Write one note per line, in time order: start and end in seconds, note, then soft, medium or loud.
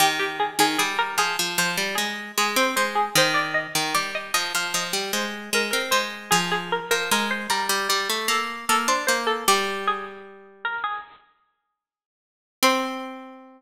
0.00 0.51 D#3 medium
0.00 0.18 G4 medium
0.19 0.38 G4 medium
0.40 0.58 G#4 medium
0.59 0.77 D#3 medium
0.59 0.78 G#4 medium
0.78 1.17 G3 medium
0.78 0.97 G#4 medium
0.99 1.17 A#4 medium
1.18 1.37 F3 medium
1.18 1.50 G#4 medium
1.39 1.58 F3 medium
1.58 1.77 F3 medium
1.58 1.97 C5 medium
1.77 1.96 G3 medium
1.95 2.32 G#3 medium
1.95 2.34 G#4 medium
2.38 2.56 G#3 medium
2.38 2.57 G#4 medium
2.56 2.75 C4 medium
2.56 2.75 C5 medium
2.76 3.10 G#3 medium
2.76 2.95 C5 medium
2.95 3.14 G#4 medium
3.15 3.67 D#3 medium
3.15 3.36 C5 medium
3.34 3.53 D5 medium
3.54 3.88 D#5 medium
3.75 3.94 D#3 medium
3.95 4.31 G3 medium
3.95 4.13 D5 medium
4.15 4.34 D#5 medium
4.34 4.53 F3 medium
4.34 4.53 D#5 medium
4.55 4.73 F3 medium
4.55 4.74 F5 medium
4.74 4.93 F3 medium
4.74 5.10 D#5 medium
4.93 5.12 G3 medium
5.13 5.50 G#3 medium
5.13 5.45 C5 medium
5.53 5.72 G#3 medium
5.53 5.70 A#4 medium
5.71 5.92 C4 medium
5.71 5.90 A#4 medium
5.91 6.31 G#3 medium
5.91 6.25 C5 medium
6.31 6.80 F3 medium
6.31 6.50 G#4 medium
6.51 6.70 G#4 medium
6.72 6.90 A#4 medium
6.91 7.10 F3 medium
6.91 7.10 A#4 medium
7.11 7.47 G#3 medium
7.11 7.31 A#4 medium
7.31 7.50 C5 medium
7.50 7.68 G3 medium
7.50 7.84 A#4 medium
7.69 7.88 G3 medium
7.89 8.08 G3 medium
7.89 8.21 D5 medium
8.10 8.28 A3 medium
8.28 8.65 A#3 medium
8.28 8.61 A4 medium
8.69 8.88 A#3 medium
8.69 8.88 A4 medium
8.88 9.07 D4 medium
8.88 9.07 C5 medium
9.07 9.44 A#3 medium
9.07 9.26 C5 medium
9.27 9.45 A4 medium
9.48 10.76 G3 medium
9.48 9.83 G4 medium
9.88 10.58 G#4 medium
10.65 10.84 A#4 medium
10.84 12.05 G#4 medium
12.63 13.62 C4 loud
12.63 13.62 C5 loud